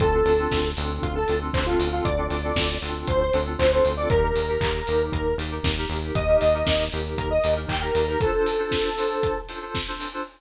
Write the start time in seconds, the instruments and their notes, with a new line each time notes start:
0.00 synth bass 1 D2, electric piano 2 C4 D4 F4 A4, lead 1 (square) A4, kick, closed hi-hat
0.14 electric piano 2 C4 D4 F4 A4
0.25 synth bass 1 D2, lead 1 (square) A4, open hi-hat
0.38 electric piano 2 C4 D4 F4 A4
0.51 synth bass 1 D2, kick, snare
0.77 synth bass 1 D2, electric piano 2 C4 D4 F4 A4, open hi-hat
1.03 synth bass 1 D2, lead 1 (square) F4, kick, closed hi-hat
1.15 lead 1 (square) A4
1.27 synth bass 1 D2, electric piano 2 C4 D4 F4 A4, open hi-hat
1.41 electric piano 2 C4 D4 F4 A4
1.54 synth bass 1 D2, lead 1 (square) C5, kick, clap
1.66 electric piano 2 C4 D4 F4 A4, lead 1 (square) F4
1.79 synth bass 1 D2, open hi-hat
1.93 electric piano 2 C4 D4 F4 A4, lead 1 (square) F4
2.05 synth bass 1 D2, lead 1 (square) D5, kick, closed hi-hat
2.18 electric piano 2 C4 D4 F4 A4
2.30 synth bass 1 D2, lead 1 (square) D5, open hi-hat
2.44 electric piano 2 C4 D4 F4 A4
2.56 synth bass 1 D2, kick, snare
2.82 synth bass 1 D2, electric piano 2 C4 D4 F4 A4, open hi-hat
3.07 synth bass 1 D2, lead 1 (square) C5, kick, closed hi-hat
3.21 lead 1 (square) C5
3.33 synth bass 1 D2, electric piano 2 C4 D4 F4 A4, open hi-hat
3.46 electric piano 2 C4 D4 F4 A4
3.59 synth bass 1 D2, lead 1 (square) C5, kick, clap
3.71 electric piano 2 C4 D4 F4 A4, lead 1 (square) C5
3.85 synth bass 1 D2, open hi-hat
3.97 electric piano 2 C4 D4 F4 A4, lead 1 (square) D5
4.10 synth bass 1 D#2, electric piano 2 D#4 G4 A#4, lead 1 (square) A#4, kick, closed hi-hat
4.23 electric piano 2 D#4 G4 A#4
4.36 synth bass 1 D#2, open hi-hat
4.48 electric piano 2 D#4 G4 A#4
4.61 synth bass 1 D#2, kick, clap
4.87 synth bass 1 D#2, electric piano 2 D#4 G4 A#4, open hi-hat
5.12 synth bass 1 D#2, lead 1 (square) A#4, kick, closed hi-hat
5.38 synth bass 1 D#2, electric piano 2 D#4 G4 A#4, open hi-hat
5.51 electric piano 2 D#4 G4 A#4
5.63 synth bass 1 D#2, kick, snare
5.77 electric piano 2 D#4 G4 A#4
5.90 synth bass 1 D#2, open hi-hat
6.02 electric piano 2 D#4 G4 A#4
6.15 synth bass 1 D#2, lead 1 (square) D#5, kick, closed hi-hat
6.28 electric piano 2 D#4 G4 A#4
6.41 synth bass 1 D#2, lead 1 (square) D#5, open hi-hat
6.54 electric piano 2 D#4 G4 A#4
6.66 synth bass 1 D#2, kick, snare
6.92 synth bass 1 D#2, electric piano 2 D#4 G4 A#4, open hi-hat
7.17 synth bass 1 D#2, lead 1 (square) A#4, kick, closed hi-hat
7.31 lead 1 (square) D#5
7.44 synth bass 1 D#2, electric piano 2 D#4 G4 A#4, open hi-hat
7.56 electric piano 2 D#4 G4 A#4
7.68 synth bass 1 D#2, lead 1 (square) G5, kick, clap
7.81 electric piano 2 D#4 G4 A#4, lead 1 (square) A#4
7.95 synth bass 1 D#2, open hi-hat
8.08 electric piano 2 D#4 G4 A#4, lead 1 (square) A#4
8.20 electric piano 2 D4 F4 A4 C5, lead 1 (square) A4, kick, closed hi-hat
8.34 electric piano 2 D4 F4 A4 C5
8.46 open hi-hat
8.59 electric piano 2 D4 F4 A4 C5
8.71 kick, snare
8.97 electric piano 2 D4 F4 A4 C5, open hi-hat
9.23 kick, closed hi-hat
9.49 electric piano 2 D4 F4 A4 C5, open hi-hat
9.62 electric piano 2 D4 F4 A4 C5
9.75 kick, snare
9.88 electric piano 2 D4 F4 A4 C5
10.00 open hi-hat
10.13 electric piano 2 D4 F4 A4 C5